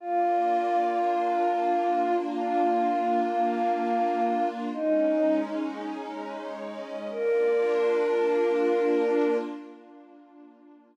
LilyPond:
<<
  \new Staff \with { instrumentName = "Choir Aahs" } { \time 3/4 \key bes \mixolydian \tempo 4 = 76 f'2. | f'2. | ees'4 r2 | bes'2. | }
  \new Staff \with { instrumentName = "Pad 5 (bowed)" } { \time 3/4 \key bes \mixolydian <bes d' f'>2.~ | <bes d' f'>2. | <aes des' ees'>2. | <bes d' f'>2. | }
>>